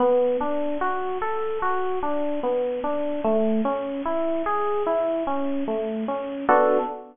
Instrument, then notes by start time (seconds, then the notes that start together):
electric piano 1
0.00 B3
0.41 D4
0.81 F#4
1.22 A4
1.62 F#4
2.03 D4
2.43 B3
2.84 D4
3.24 A3
3.65 C#4
4.05 E4
4.46 G#4
4.86 E4
5.27 C#4
5.68 A3
6.08 C#4
6.49 B3 D4 F#4 A4